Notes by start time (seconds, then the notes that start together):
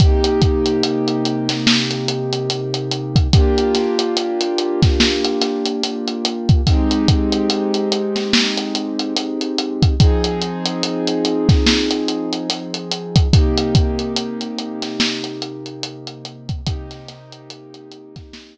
0.00 C3 A#3 D#4 G4, kick, closed hi-hat
0.24 closed hi-hat
0.42 kick, closed hi-hat
0.66 closed hi-hat
0.83 closed hi-hat
1.08 closed hi-hat
1.25 closed hi-hat
1.49 snare, closed hi-hat
1.67 snare
1.91 closed hi-hat
2.08 closed hi-hat
2.33 closed hi-hat
2.50 closed hi-hat
2.74 closed hi-hat
2.91 closed hi-hat
3.16 kick, closed hi-hat
3.33 A#3 D4 F4 G4, kick, closed hi-hat
3.58 closed hi-hat
3.75 snare, closed hi-hat
3.99 closed hi-hat
4.17 closed hi-hat
4.41 closed hi-hat
4.58 closed hi-hat
4.82 kick, snare, closed hi-hat
5.00 snare
5.24 closed hi-hat
5.41 snare, closed hi-hat
5.65 closed hi-hat
5.84 closed hi-hat
6.08 closed hi-hat
6.25 closed hi-hat
6.49 kick, closed hi-hat
6.67 G#3 C4 D#4 G4, kick, closed hi-hat
6.91 closed hi-hat
7.08 kick, closed hi-hat
7.32 closed hi-hat
7.50 closed hi-hat
7.74 closed hi-hat
7.92 closed hi-hat
8.16 snare, closed hi-hat
8.33 snare
8.57 closed hi-hat
8.75 closed hi-hat
8.99 closed hi-hat
9.16 closed hi-hat
9.41 closed hi-hat
9.58 closed hi-hat
9.82 kick, closed hi-hat
10.00 F3 C4 D#4 G#4, kick, closed hi-hat
10.24 closed hi-hat
10.42 closed hi-hat
10.66 closed hi-hat
10.83 closed hi-hat
11.07 closed hi-hat
11.25 closed hi-hat
11.49 kick, snare, closed hi-hat
11.66 snare
11.91 closed hi-hat
12.08 closed hi-hat
12.33 closed hi-hat
12.50 closed hi-hat
12.74 closed hi-hat
12.91 closed hi-hat
13.16 kick, closed hi-hat
13.33 C3 A#3 D#4 G4, kick, closed hi-hat
13.57 closed hi-hat
13.75 kick, closed hi-hat
13.99 closed hi-hat
14.16 closed hi-hat
14.41 closed hi-hat
14.59 closed hi-hat
14.82 snare, closed hi-hat
15.00 snare
15.24 closed hi-hat
15.42 closed hi-hat
15.66 closed hi-hat
15.83 closed hi-hat
16.07 closed hi-hat
16.25 closed hi-hat
16.49 kick, closed hi-hat
16.66 C3 A#3 D#4 G4, kick, closed hi-hat
16.91 snare, closed hi-hat
17.09 snare, closed hi-hat
17.32 closed hi-hat
17.50 closed hi-hat
17.74 closed hi-hat
17.91 closed hi-hat
18.16 kick, snare, closed hi-hat
18.33 snare